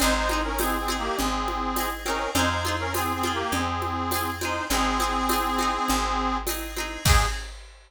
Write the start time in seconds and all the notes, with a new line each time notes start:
0.00 G#1 C4 D#4 G#4 C5, cowbell, low conga
0.15 D#4 C5
0.29 C4 D#4 G#4, high conga
0.44 C#4 A#4
0.59 C4 D#4 G#4, tambourine, cowbell, high conga
0.78 C4 G#4
0.88 C4 D#4 G#4, high conga
0.98 A#3 G4
1.17 G#1 C4 G#4, cowbell, low conga
1.48 high conga
1.76 C4 D#4, tambourine, cowbell, high conga
1.80 G#4
2.06 C4 C#4 D#4 A#4, high conga
2.10 G#4
2.35 F2 C4 D#4 F4 C5, cowbell, low conga
2.39 G#4
2.50 D#4 C5
2.65 C4 F4 G#4, high conga
2.79 C#4 A#4
2.94 C4 F4 G#4, tambourine, cowbell, high conga
2.98 G#4
3.13 C4 G#4
3.23 C4 F4 G#4, high conga
3.33 A#3 G4
3.52 F2 C4 G#4, cowbell, low conga
3.82 high conga
4.11 C4 F4, tambourine, cowbell, high conga
4.15 G#4
4.41 C4 D#4 F4 G#4 C5, high conga
4.70 G#1 C4 D#4 G#4, cowbell, low conga
4.74 G#4
5.00 C4 D#4 G#4, high conga
5.29 C4 D#4, tambourine, cowbell, high conga
5.33 G#4
5.58 C4 D#4, high conga
5.62 G#4
5.88 G#1, cowbell, low conga
6.47 C4 D#4, tambourine, cowbell, high conga
6.51 G#4
6.76 C4 D#4 G#4, high conga
7.05 G#2 C4 D#4 G#4, kick, crash
7.10 G#4